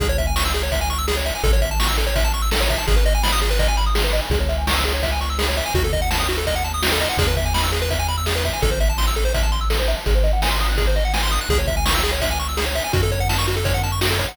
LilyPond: <<
  \new Staff \with { instrumentName = "Lead 1 (square)" } { \time 4/4 \key cis \minor \tempo 4 = 167 gis'16 cis''16 e''16 gis''16 cis'''16 e'''16 gis'16 cis''16 e''16 gis''16 cis'''16 e'''16 gis'16 cis''16 e''16 gis''16 | a'16 cis''16 e''16 a''16 cis'''16 e'''16 a'16 cis''16 e''16 a''16 cis'''16 e'''16 a'16 cis''16 e''16 a''16 | gis'16 b'16 dis''16 gis''16 b''16 dis'''16 gis'16 b'16 dis''16 gis''16 b''16 dis'''16 gis'16 b'16 dis''16 gis''16 | gis'16 cis''16 e''16 gis''16 cis'''16 e'''16 gis'16 cis''16 e''16 gis''16 cis'''16 e'''16 gis'16 cis''16 e''16 gis''16 |
fis'16 a'16 dis''16 fis''16 a''16 dis'''16 fis'16 a'16 dis''16 fis''16 a''16 dis'''16 fis'16 a'16 dis''16 fis''16 | gis'16 b'16 e''16 gis''16 b''16 e'''16 gis'16 b'16 e''16 gis''16 b''16 e'''16 gis'16 b'16 e''16 gis''16 | a'16 c''16 e''16 a''16 c'''16 e'''16 a'16 c''16 e''16 a''16 c'''16 e'''16 a'16 c''16 e''16 a''16 | gis'16 bis'16 dis''16 fis''16 gis''16 bis''16 dis'''16 fis'''16 gis'16 bis'16 dis''16 fis''16 gis''16 bis''16 dis'''16 fis'''16 |
gis'16 cis''16 e''16 gis''16 cis'''16 e'''16 gis'16 cis''16 e''16 gis''16 cis'''16 e'''16 gis'16 cis''16 e''16 gis''16 | fis'16 a'16 cis''16 fis''16 a''16 cis'''16 fis'16 a'16 cis''16 fis''16 a''16 cis'''16 fis'16 a'16 cis''16 fis''16 | }
  \new Staff \with { instrumentName = "Synth Bass 1" } { \clef bass \time 4/4 \key cis \minor cis,1 | a,,1 | gis,,1 | cis,1 |
dis,1 | e,1 | a,,1 | gis,,1 |
cis,1 | fis,1 | }
  \new DrumStaff \with { instrumentName = "Drums" } \drummode { \time 4/4 <hh bd>8 <hh bd>8 sn8 hh8 <hh bd>8 hh8 sn8 hh8 | <hh bd>8 <hh bd>8 sn8 hh8 <hh bd>8 hh8 sn8 <hh bd>8 | <hh bd>8 hh8 sn8 hh8 <hh bd>8 hh8 sn8 hh8 | <hh bd>8 hh8 sn8 hh8 <hh bd>8 hh8 sn8 hh8 |
<hh bd>8 <hh bd>8 sn8 hh8 <hh bd>8 hh8 sn8 hh8 | <hh bd>8 <hh bd>8 sn8 hh8 <hh bd>8 hh8 sn8 <hh bd>8 | <hh bd>8 hh8 sn8 hh8 <hh bd>8 hh8 sn8 hh8 | <hh bd>8 hh8 sn8 hh8 <hh bd>8 hh8 sn8 hh8 |
<hh bd>8 <hh bd>8 sn8 hh8 <hh bd>8 hh8 sn8 hh8 | <hh bd>8 <hh bd>8 sn8 hh8 <hh bd>8 hh8 sn8 <hh bd>8 | }
>>